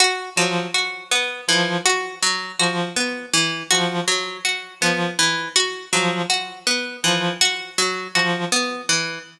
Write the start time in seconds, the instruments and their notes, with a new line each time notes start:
0.00 harpsichord F#4
0.36 clarinet F3, harpsichord F#3
0.74 harpsichord F#4
1.11 harpsichord B3
1.48 harpsichord E3, clarinet F3
1.85 harpsichord F#4
2.22 harpsichord F#3
2.59 clarinet F3, harpsichord F#4
2.96 harpsichord B3
3.33 harpsichord E3
3.70 clarinet F3, harpsichord F#4
4.07 harpsichord F#3
4.44 harpsichord F#4
4.81 clarinet F3, harpsichord B3
5.19 harpsichord E3
5.56 harpsichord F#4
5.92 clarinet F3, harpsichord F#3
6.30 harpsichord F#4
6.67 harpsichord B3
7.03 harpsichord E3, clarinet F3
7.41 harpsichord F#4
7.78 harpsichord F#3
8.15 clarinet F3, harpsichord F#4
8.52 harpsichord B3
8.89 harpsichord E3